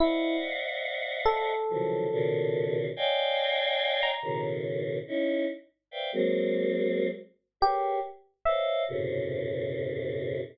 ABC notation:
X:1
M:7/8
L:1/16
Q:1/4=71
K:none
V:1 name="Choir Aahs"
[cd^def^f]8 [C,^C,^D,E,=F,^F,]2 [^A,,B,,C,D,]4 | [^cd^dfg^g]6 [A,,B,,^C,^D,]4 [^C^DE]2 z2 | [Bcdefg] [^F,^G,^A,C]5 z2 [=G^G^AB^c]2 z2 [B=c^c^d=f]2 | [^F,,^G,,A,,B,,C,^C,]8 z6 |]
V:2 name="Electric Piano 1"
E2 z4 A8 | z5 ^a2 z7 | z8 G2 z2 e2 | z14 |]